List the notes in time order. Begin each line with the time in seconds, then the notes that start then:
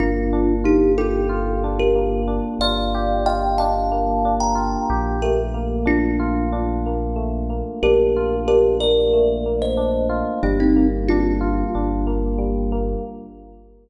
0.00 G1 A#3 D4 F4
0.33 D4
0.64 D#4 F4 G4
0.98 F4 G4 A4
1.29 F4
1.64 D4
1.79 G4 A#4
1.95 A#3
2.28 D4
2.59 G1 F4 D5 F5
2.95 G4
3.26 F4 D#5 G5
3.58 D4 F5 A5
3.92 A#3
4.25 D4
4.40 G5 A#5
4.55 F4
4.90 A#1 G4
5.22 A3 G4 A#4
5.54 A#3
5.86 D4 F4
6.20 F4
6.52 D4
6.86 A#3
7.16 A3
7.50 A#3
7.83 A#1 D4 G4 A#4
8.16 F4
8.48 D4 G4 A#4
8.80 A#3 A#4 D5
9.13 A3
9.46 A#3
9.62 C5 D#5
9.77 D4
10.10 F4
10.43 G1 G3 A#3 D4
10.60 C4 D#4
10.76 A#3
11.08 D4 F4
11.41 F4
11.75 G1 D4
12.07 A#3
12.38 G3
12.72 A#3